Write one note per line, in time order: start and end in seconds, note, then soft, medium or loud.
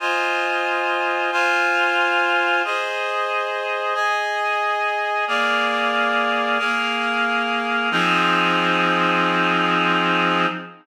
0.00 1.30 F4 medium
0.00 1.30 C5 medium
0.00 1.30 D#5 medium
0.00 1.30 G#5 medium
1.32 2.62 F4 medium
1.32 2.62 C5 medium
1.32 2.62 F5 loud
1.32 2.62 G#5 medium
2.64 3.94 G#4 medium
2.64 3.95 C5 medium
2.64 3.94 D#5 medium
3.94 5.25 G#4 medium
3.94 5.25 D#5 medium
3.94 5.25 G#5 medium
5.27 6.58 A#3 medium
5.27 6.58 G#4 medium
5.27 6.58 D5 medium
5.27 6.58 F5 medium
6.59 7.89 A#3 medium
6.59 7.89 G#4 medium
6.59 7.89 A#4 medium
6.59 7.89 F5 medium
7.91 10.46 F3 loud
7.91 10.46 C4 loud
7.91 10.46 D#4 loud
7.91 10.46 G#4 medium